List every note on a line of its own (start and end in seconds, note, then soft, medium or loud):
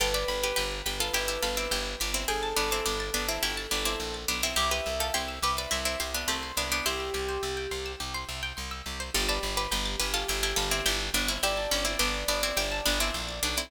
0.00 0.24 G1 loud
0.00 0.14 F4 medium
0.00 0.14 A4 medium
0.00 2.10 B4 medium
0.00 0.13 G5 medium
0.14 0.39 B4 medium
0.14 0.39 D5 medium
0.14 0.27 A5 medium
0.28 0.52 G1 medium
0.28 0.41 B5 medium
0.43 0.56 G4 medium
0.43 0.56 B4 medium
0.43 0.56 D6 medium
0.56 0.82 G1 medium
0.56 0.79 G4 medium
0.56 0.79 B4 medium
0.56 0.70 G6 medium
0.71 0.84 A6 medium
0.86 1.10 G1 medium
0.86 1.00 G4 medium
0.86 1.00 B4 medium
0.86 0.99 B6 medium
1.00 1.14 F4 medium
1.00 1.14 A4 medium
1.00 1.13 D7 soft
1.13 1.38 G1 medium
1.13 1.28 E4 medium
1.13 1.28 G4 medium
1.13 1.27 G5 medium
1.28 1.42 E4 medium
1.28 1.42 G4 medium
1.28 1.42 A5 medium
1.43 1.68 G1 medium
1.43 1.56 F4 medium
1.43 1.56 A4 medium
1.43 1.56 B5 medium
1.57 1.71 C4 medium
1.57 1.71 E4 medium
1.57 1.70 D6 medium
1.71 1.95 G1 loud
1.71 2.00 E4 medium
1.71 2.00 G4 medium
1.71 1.84 G6 medium
1.86 1.99 A6 medium
2.00 2.25 G1 medium
2.00 2.14 B3 medium
2.00 2.14 D4 medium
2.00 2.13 B6 medium
2.14 2.28 C4 medium
2.14 2.28 E4 medium
2.14 2.27 D7 medium
2.28 2.53 G1 medium
2.28 2.56 G#4 medium
2.28 4.15 A4 medium
2.28 2.41 G5 medium
2.43 2.56 A5 medium
2.56 2.81 G1 medium
2.56 2.70 B3 medium
2.56 2.70 D4 medium
2.56 2.70 B5 medium
2.71 2.86 C4 medium
2.71 2.86 E4 medium
2.71 2.84 D6 medium
2.86 3.10 G1 medium
2.86 3.13 B3 medium
2.86 3.13 D4 medium
2.86 2.99 G6 medium
3.00 3.13 A6 medium
3.14 3.39 G1 medium
3.14 3.28 B3 medium
3.14 3.28 D4 medium
3.14 3.27 B6 medium
3.28 3.42 C4 medium
3.28 3.42 E4 medium
3.28 3.41 D7 medium
3.43 3.67 G1 medium
3.43 3.66 E4 medium
3.43 3.66 G4 medium
3.43 3.56 G5 medium
3.57 3.70 A5 medium
3.71 3.96 G1 medium
3.71 3.85 B3 medium
3.71 3.85 D4 medium
3.71 3.84 B5 medium
3.85 4.20 C4 medium
3.85 4.20 E4 medium
3.85 3.99 D6 medium
4.00 4.25 A#1 medium
4.00 4.13 G6 medium
4.14 4.27 A6 medium
4.28 4.54 B1 medium
4.28 4.42 B3 medium
4.28 4.42 D4 medium
4.28 4.42 B6 medium
4.43 4.57 C4 medium
4.43 4.56 E4 medium
4.43 4.56 D7 medium
4.56 4.81 C2 loud
4.56 4.70 E4 medium
4.56 4.70 G4 medium
4.56 6.40 E5 medium
4.71 4.94 G4 medium
4.71 4.94 B4 medium
4.71 4.85 C5 medium
4.86 5.11 C2 medium
4.86 4.99 E5 medium
5.00 5.14 F4 medium
5.00 5.14 A4 medium
5.00 5.13 G5 medium
5.14 5.39 C2 medium
5.14 5.39 E4 medium
5.14 5.39 G4 medium
5.14 5.27 C6 medium
5.28 5.41 E6 medium
5.42 5.67 C2 medium
5.42 5.56 G4 medium
5.42 5.57 G4 medium
5.42 5.57 B4 medium
5.57 5.72 B4 medium
5.57 5.70 C5 medium
5.57 5.72 D5 medium
5.71 5.96 C2 medium
5.71 5.84 C4 medium
5.71 5.84 E4 medium
5.71 5.84 E5 medium
5.85 5.99 C4 medium
5.85 5.99 E4 medium
5.85 5.99 G5 medium
6.00 6.25 C2 medium
6.00 6.13 E4 medium
6.00 6.13 G4 medium
6.00 6.13 C6 medium
6.14 6.28 B3 medium
6.14 6.28 D4 medium
6.14 6.27 E6 medium
6.28 6.52 C2 medium
6.28 6.52 A3 medium
6.28 6.52 C4 medium
6.28 6.41 G4 medium
6.43 6.56 C5 medium
6.57 6.81 C2 medium
6.57 6.71 B3 medium
6.57 6.71 D4 medium
6.57 6.70 E5 medium
6.71 6.85 B3 medium
6.71 6.85 D4 medium
6.71 6.84 G5 medium
6.86 7.10 C2 medium
6.86 8.79 C4 medium
6.86 8.79 E4 medium
6.86 7.92 G4 medium
6.86 6.99 C6 medium
7.00 7.13 E6 medium
7.14 7.38 C2 medium
7.14 7.27 G4 medium
7.29 7.41 C5 medium
7.43 7.67 C2 medium
7.43 7.56 E5 medium
7.57 7.70 G5 medium
7.71 7.96 C2 medium
7.71 7.84 C6 medium
7.86 7.99 E6 medium
8.00 8.25 C2 medium
8.00 8.13 G4 medium
8.14 8.27 C5 medium
8.29 8.53 C2 medium
8.29 8.41 E5 medium
8.43 8.56 G5 medium
8.57 8.82 C2 medium
8.57 8.70 C6 medium
8.71 8.84 E6 medium
8.86 9.10 C2 medium
8.86 8.99 G4 medium
9.00 9.13 C5 medium
9.14 9.39 G1 loud
9.14 9.28 F4 medium
9.14 11.11 G4 medium
9.14 9.28 A4 medium
9.14 9.27 G5 medium
9.29 9.56 B4 medium
9.29 9.56 D5 medium
9.29 9.41 A5 medium
9.43 9.67 G1 medium
9.43 9.56 B5 medium
9.57 9.71 G4 medium
9.57 9.71 B4 medium
9.57 9.70 D6 medium
9.71 9.96 G1 loud
9.71 9.99 G4 medium
9.71 9.99 B4 medium
9.71 9.84 G6 medium
9.86 9.98 A6 medium
10.00 10.24 G1 loud
10.00 10.13 G4 medium
10.00 10.13 B4 medium
10.00 10.13 B6 medium
10.14 10.27 F4 medium
10.14 10.27 A4 medium
10.14 10.27 D7 medium
10.28 10.53 G1 loud
10.28 10.43 E4 medium
10.28 10.43 G4 medium
10.28 10.41 G5 medium
10.43 10.57 E4 medium
10.43 10.57 G4 medium
10.43 10.56 A5 medium
10.56 10.81 G1 loud
10.56 10.70 F4 medium
10.56 10.70 A4 medium
10.56 10.70 B5 medium
10.71 10.85 C4 medium
10.71 10.85 E4 medium
10.71 10.84 D6 medium
10.86 11.10 G1 loud
10.86 11.11 E4 medium
10.86 11.11 G4 medium
10.86 10.99 G6 medium
11.00 11.13 A6 medium
11.14 11.38 G1 loud
11.14 11.28 B3 medium
11.14 11.28 D4 medium
11.14 11.27 B6 medium
11.28 11.42 C4 medium
11.28 11.42 E4 medium
11.28 11.42 D7 medium
11.43 11.67 G1 medium
11.43 11.70 E4 medium
11.43 11.70 G4 medium
11.43 13.63 D5 medium
11.43 11.56 G5 medium
11.57 11.70 A5 medium
11.71 11.96 G1 loud
11.71 11.85 C#4 medium
11.71 11.85 B5 medium
11.85 11.98 C4 medium
11.85 11.98 E4 medium
11.85 11.99 D6 medium
11.99 12.24 G1 loud
11.99 12.27 B3 medium
11.99 12.27 D4 medium
11.99 12.13 G6 medium
12.14 12.27 A6 medium
12.28 12.52 G1 medium
12.28 12.42 B3 medium
12.28 12.42 D4 medium
12.28 12.41 B6 medium
12.43 12.57 C4 medium
12.43 12.57 E4 medium
12.43 12.56 D7 medium
12.57 12.81 G1 medium
12.57 12.83 E4 medium
12.57 12.83 G4 medium
12.57 12.70 G5 medium
12.72 12.84 A5 medium
12.86 13.11 G1 loud
12.86 12.99 B3 medium
12.86 12.99 D4 medium
12.86 12.98 B5 medium
13.00 13.37 C4 medium
13.00 13.37 E4 medium
13.00 13.13 D6 medium
13.14 13.40 A#1 medium
13.14 13.27 G6 medium
13.29 13.41 A6 medium
13.43 13.68 B1 medium
13.43 13.56 B3 medium
13.43 13.56 D4 medium
13.43 13.56 B6 medium
13.57 13.71 C4 medium
13.57 13.71 E4 medium
13.57 13.70 D7 medium